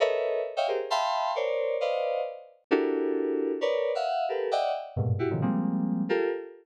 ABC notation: X:1
M:4/4
L:1/16
Q:1/4=133
K:none
V:1 name="Electric Piano 2"
[A_B=B_d_e=e]4 z [d_e=efg] [G_A_Bc] z [efg=a=bc']4 [_Bcd=d]4 | [Bcd_ef]4 z4 [D=E_G=GA_B]8 | [_B=B_d=d]3 [ef_g]3 [=GA_B=B]2 [d_e=e_g=g]2 z2 [G,,_A,,_B,,=B,,]2 [E_G=G] [=A,,_B,,C,_D,_E,F,] | [F,G,_A,_B,C]6 [FG=A_B]2 z8 |]